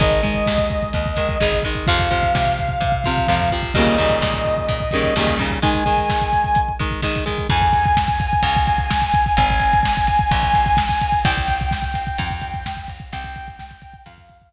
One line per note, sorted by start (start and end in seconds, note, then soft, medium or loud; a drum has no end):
0.00 0.42 G#1 medium
0.00 0.21 D#3 medium
0.00 0.21 G#3 medium
0.00 1.58 D#5 medium
0.00 kick loud
0.00 closed hi-hat medium
0.11 kick medium
0.23 1.09 D#3 medium
0.23 1.09 G#3 medium
0.23 kick medium
0.23 closed hi-hat medium
0.34 kick medium
0.46 0.90 D#2 medium
0.46 kick medium
0.46 snare loud
0.58 kick medium
0.70 kick medium
0.70 closed hi-hat medium
0.83 kick medium
0.93 1.36 D#2 medium
0.93 kick medium
0.93 closed hi-hat loud
1.06 kick medium
1.16 1.38 D#3 medium
1.16 1.38 G#3 medium
1.16 kick medium
1.16 closed hi-hat medium
1.29 kick medium
1.40 1.84 G#1 medium
1.40 1.63 D#3 medium
1.40 1.63 G#3 medium
1.40 kick medium
1.40 snare loud
1.53 kick medium
1.63 1.86 D#3 medium
1.63 1.86 G#3 medium
1.63 kick medium
1.63 closed hi-hat medium
1.75 kick medium
1.87 2.31 F2 loud
1.87 2.09 C3 medium
1.87 2.09 F3 medium
1.87 3.52 F5 medium
1.87 kick loud
1.87 closed hi-hat medium
1.99 kick medium
2.11 2.97 C3 medium
2.11 2.97 F3 medium
2.11 kick medium
2.11 closed hi-hat medium
2.23 kick medium
2.35 2.77 C3 medium
2.35 kick medium
2.35 snare loud
2.46 kick medium
2.58 kick medium
2.58 closed hi-hat medium
2.69 kick medium
2.81 3.23 C3 medium
2.81 kick medium
2.81 closed hi-hat medium
2.92 kick medium
3.04 3.27 C3 medium
3.04 3.27 F3 medium
3.04 kick medium
3.04 closed hi-hat medium
3.17 kick medium
3.27 3.71 F2 medium
3.27 3.50 C3 medium
3.27 3.50 F3 medium
3.27 kick medium
3.27 snare medium
3.40 kick medium
3.50 3.74 C3 medium
3.50 3.74 F3 medium
3.50 kick medium
3.50 closed hi-hat medium
3.63 kick medium
3.74 4.17 D#2 medium
3.74 3.97 C#3 medium
3.74 3.97 D#3 medium
3.74 3.97 G3 medium
3.74 5.36 D#5 medium
3.74 kick medium
3.74 closed hi-hat loud
3.79 3.97 A#2 medium
3.87 kick medium
3.97 4.83 A#2 medium
3.97 4.83 C#3 medium
3.97 4.83 D#3 medium
3.97 4.83 G3 medium
3.97 kick medium
3.97 closed hi-hat medium
4.10 kick medium
4.22 4.64 A#2 medium
4.22 kick medium
4.22 snare loud
4.34 kick medium
4.45 kick medium
4.45 closed hi-hat medium
4.58 kick medium
4.68 5.11 A#2 medium
4.68 kick medium
4.68 closed hi-hat loud
4.80 kick medium
4.91 5.14 C#3 medium
4.91 5.14 D#3 medium
4.91 5.14 G3 medium
4.91 kick medium
4.91 closed hi-hat medium
4.96 5.14 A#2 medium
5.04 kick medium
5.16 5.58 D#2 medium
5.16 5.38 C#3 medium
5.16 5.38 D#3 medium
5.16 5.37 G3 medium
5.16 kick medium
5.16 snare loud
5.20 5.38 A#2 medium
5.28 kick medium
5.38 5.59 A#2 medium
5.38 5.59 C#3 medium
5.38 5.59 D#3 medium
5.38 5.59 G3 medium
5.38 kick medium
5.38 closed hi-hat medium
5.50 kick medium
5.62 5.84 D#3 medium
5.62 5.84 G#3 medium
5.62 6.62 G#5 medium
5.62 kick loud
5.62 closed hi-hat loud
5.74 kick medium
5.86 6.72 D#3 medium
5.86 6.72 G#3 medium
5.86 kick medium
5.86 closed hi-hat medium
5.97 kick medium
6.09 kick medium
6.09 snare loud
6.21 kick medium
6.33 kick medium
6.33 closed hi-hat medium
6.44 kick medium
6.55 kick medium
6.55 closed hi-hat medium
6.68 kick medium
6.79 7.01 D#3 medium
6.79 7.01 G#3 medium
6.79 kick medium
6.79 closed hi-hat medium
6.91 kick medium
7.02 7.24 D#3 medium
7.02 7.24 G#3 medium
7.02 kick medium
7.02 snare medium
7.16 kick medium
7.26 7.47 D#3 medium
7.26 7.47 G#3 medium
7.26 kick medium
7.26 open hi-hat medium
7.38 kick medium
7.50 8.36 F2 loud
7.50 9.32 G#5 medium
7.50 kick loud
7.50 crash loud
7.62 kick medium
7.73 kick medium
7.73 ride medium
7.86 kick loud
7.97 kick loud
7.97 snare loud
8.08 kick loud
8.20 kick loud
8.20 ride medium
8.33 kick medium
8.43 9.29 C#2 loud
8.43 kick medium
8.43 ride loud
8.57 kick loud
8.67 kick medium
8.67 ride medium
8.78 kick medium
8.90 kick loud
8.90 snare loud
9.02 kick medium
9.14 kick loud
9.14 ride medium
9.26 kick medium
9.37 10.24 G#1 loud
9.37 11.19 G#5 medium
9.37 kick loud
9.37 ride loud
9.50 kick loud
9.60 kick medium
9.60 ride medium
9.73 kick medium
9.83 kick medium
9.83 snare loud
9.97 kick loud
10.07 kick medium
10.07 ride medium
10.19 kick loud
10.31 11.18 A#1 medium
10.31 kick loud
10.31 ride loud
10.43 kick medium
10.54 kick medium
10.54 ride medium
10.66 kick medium
10.77 kick loud
10.77 snare loud
10.89 kick loud
11.01 kick medium
11.01 ride medium
11.12 kick medium
11.25 12.11 C2 loud
11.25 12.79 G5 medium
11.25 kick loud
11.25 ride loud
11.38 kick loud
11.48 kick medium
11.48 ride medium
11.61 kick medium
11.71 kick loud
11.71 snare loud
11.82 kick medium
11.94 kick medium
11.94 ride medium
12.07 kick medium
12.18 13.05 F2 loud
12.18 kick loud
12.18 ride loud
12.31 kick loud
12.41 kick medium
12.41 ride medium
12.54 kick medium
12.66 kick medium
12.66 snare loud
12.77 kick medium
12.88 kick medium
12.88 ride medium
13.00 kick medium
13.12 13.99 C2 loud
13.12 13.96 G5 loud
13.12 kick loud
13.12 ride loud
13.24 kick loud
13.36 kick loud
13.36 ride medium
13.48 kick loud
13.59 kick loud
13.59 snare loud
13.71 kick medium
13.82 kick loud
13.82 ride medium
13.94 kick loud
14.06 14.53 F2 medium
14.06 14.49 F5 medium
14.06 kick loud
14.06 ride loud
14.18 kick medium
14.29 kick medium
14.29 ride medium
14.42 kick medium